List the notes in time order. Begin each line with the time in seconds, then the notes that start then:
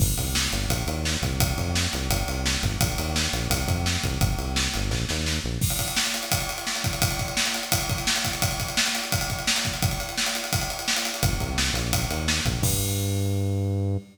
0.00 G1, kick, crash
0.18 C2, kick, ride
0.35 snare
0.52 G1, ride
0.69 A#1, kick, ride
0.87 D#2, ride
1.05 snare
1.22 C2, kick, ride
1.40 kick, ride
1.58 F2, kick, ride
1.75 snare
1.93 C2, ride
2.10 G1, kick, ride
2.27 C2, ride
2.46 snare
2.63 G1, kick, ride
2.80 A#1, kick, ride
2.98 D#2, ride
3.16 snare
3.33 A#1, ride
3.50 C2, kick, ride
3.68 F2, kick, ride
3.86 snare
4.04 C2, kick, ride
4.21 G1, kick, ride
4.38 C2, ride
4.56 snare
4.74 G1, ride
4.90 A#1, kick, snare
5.09 D#2, snare
5.26 snare
5.44 A#1
5.61 kick, crash
5.70 ride
5.79 kick, ride
5.88 ride
5.96 snare
6.05 ride
6.14 ride
6.23 ride
6.32 kick, ride
6.40 ride
6.49 ride
6.58 ride
6.67 snare
6.75 ride
6.84 kick, ride
6.93 ride
7.02 kick, ride
7.11 ride
7.19 kick, ride
7.28 ride
7.37 snare
7.46 ride
7.54 ride
7.63 ride
7.72 kick, ride
7.81 ride
7.89 kick, ride
7.98 ride
8.07 snare
8.16 ride
8.25 kick, ride
8.33 ride
8.42 kick, ride
8.51 ride
8.60 kick, ride
8.68 ride
8.77 snare
8.86 ride
8.95 ride
9.04 ride
9.12 kick, ride
9.21 ride
9.30 kick, ride
9.39 ride
9.47 snare
9.56 ride
9.65 kick, ride
9.74 ride
9.82 kick, ride
9.91 ride
10.00 ride
10.09 ride
10.18 snare
10.26 ride
10.35 ride
10.44 ride
10.53 kick, ride
10.61 ride
10.70 ride
10.79 ride
10.88 snare
10.96 ride
11.05 ride
11.14 ride
11.23 G1, kick, ride
11.40 C2, kick, ride
11.58 snare
11.74 A#1, ride
11.93 kick, ride
12.11 D#2, ride
12.28 snare
12.45 A#1, kick, ride
12.62 G2, kick, crash